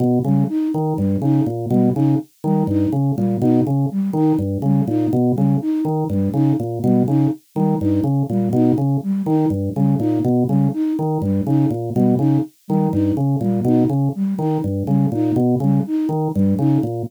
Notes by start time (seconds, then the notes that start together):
0.00 B2
0.24 C#3 G3
0.49 D#4
0.74 D#3
0.97 G2 G3
1.22 C#3 D#4
1.46 A#2
1.70 B2 G3
1.95 C#3 D#4
2.44 D#3 G3
2.67 G2 D#4
2.92 C#3
3.16 A#2 G3
3.41 B2 D#4
3.67 C#3
3.91 G3
4.13 D#3 D#4
4.39 G2
4.62 C#3 G3
4.88 A#2 D#4
5.13 B2
5.35 C#3 G3
5.61 D#4
5.85 D#3
6.10 G2 G3
6.33 C#3 D#4
6.60 A#2
6.83 B2 G3
7.08 C#3 D#4
7.55 D#3 G3
7.81 G2 D#4
8.04 C#3
8.30 A#2 G3
8.53 B2 D#4
8.78 C#3
9.03 G3
9.26 D#3 D#4
9.50 G2
9.75 C#3 G3
9.99 A#2 D#4
10.24 B2
10.48 C#3 G3
10.73 D#4
10.99 D#3
11.22 G2 G3
11.46 C#3 D#4
11.71 A#2
11.94 B2 G3
12.19 C#3 D#4
12.68 D#3 G3
12.92 G2 D#4
13.17 C#3
13.41 A#2 G3
13.65 B2 D#4
13.89 C#3
14.15 G3
14.39 D#3 D#4
14.64 G2
14.86 C#3 G3
15.12 A#2 D#4
15.36 B2
15.60 C#3 G3
15.87 D#4
16.09 D#3
16.34 G2 G3
16.59 C#3 D#4
16.83 A#2